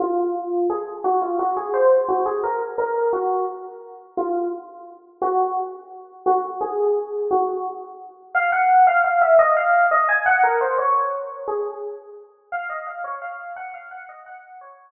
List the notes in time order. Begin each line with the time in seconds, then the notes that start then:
0.00 F4
0.70 G#4
1.04 F#4
1.22 F4
1.39 F#4
1.57 G#4
1.74 C5
2.09 F#4
2.26 G#4
2.44 A#4
2.78 A#4
3.13 F#4
4.17 F4
5.22 F#4
6.26 F#4
6.61 G#4
7.31 F#4
8.35 F5
8.52 F#5
8.87 F5
9.04 F5
9.22 E5
9.39 D#5
9.57 F5
9.91 D#5
10.09 G#5
10.26 F#5
10.44 A#4
10.61 C5
10.78 C#5
11.48 G#4
12.52 F5
12.70 D#5
12.87 F5
13.04 C#5
13.22 F5
13.56 F#5
13.74 F5
13.91 F#5
14.09 D#5
14.26 F#5
14.61 C#5